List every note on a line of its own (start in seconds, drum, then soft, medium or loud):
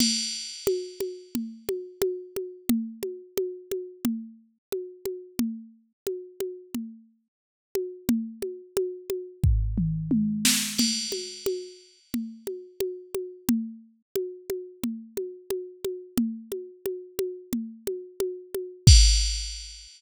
0.00 crash medium
0.00 low conga medium
0.67 high conga medium
1.00 high conga medium
1.35 low conga medium
1.69 high conga medium
2.02 high conga medium
2.36 high conga medium
2.69 low conga medium
3.03 high conga medium
3.37 high conga medium
3.71 high conga medium
4.05 low conga medium
4.72 high conga medium
5.05 high conga medium
5.39 low conga medium
6.07 high conga medium
6.40 high conga medium
6.74 low conga medium
7.75 high conga medium
8.09 low conga medium
8.42 high conga medium
8.77 high conga medium
9.10 high conga medium
9.44 kick medium
9.44 floor tom medium
9.78 mid tom medium
10.11 high tom medium
10.45 snare medium
10.78 crash medium
10.78 low conga medium
11.12 high conga medium
11.46 high conga medium
12.14 low conga medium
12.47 high conga medium
12.80 high conga medium
13.15 high conga medium
13.49 low conga medium
14.16 high conga medium
14.50 high conga medium
14.84 low conga medium
15.17 high conga medium
15.50 high conga medium
15.85 high conga medium
16.18 low conga medium
16.52 high conga medium
16.86 high conga medium
17.19 high conga medium
17.53 low conga medium
17.87 high conga medium
18.20 high conga medium
18.54 high conga medium
18.87 kick loud
18.87 crash loud